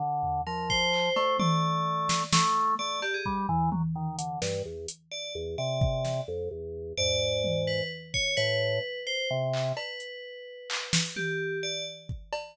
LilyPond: <<
  \new Staff \with { instrumentName = "Drawbar Organ" } { \time 6/8 \tempo 4. = 86 d4 f4. a8 | a2 a4 | a8 r8 g8 e8 fis16 r16 dis8 | d8 g,8 e,8 r4 e,8 |
c4. f,8 e,4 | gis,2 r4 | a,4 r4 c4 | r2. |
r2. | }
  \new Staff \with { instrumentName = "Tubular Bells" } { \time 6/8 r4 ais'8 c''4. | d''2 r4 | d''8 g'16 gis'16 r2 | r2 d''8 r8 |
d''4. r4. | d''4. b'8 r8 cis''8 | b'4. c''8 r4 | b'2. |
g'4 d''8 r4. | }
  \new DrumStaff \with { instrumentName = "Drums" } \drummode { \time 6/8 r8 tomfh4 bd8 hc8 cb8 | tommh4. sn8 sn4 | r8 cb8 bd8 tomfh8 tommh4 | hh8 sn4 hh4. |
r8 bd8 sn8 r4. | tomfh4 tommh8 r4 bd8 | hh4. r4 hc8 | cb8 hh4 r8 hc8 sn8 |
tommh4. r8 bd8 cb8 | }
>>